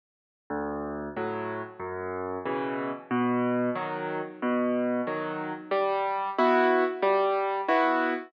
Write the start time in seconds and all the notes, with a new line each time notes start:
0.50 D2
1.16 A2 F#3
1.79 F#2
2.45 B2 C#3 E3
3.11 B2
3.75 D#3 F#3
4.42 B2
5.07 D#3 F#3
5.71 G3
6.38 B3 E4 F#4
7.02 G3
7.68 B3 E4 F#4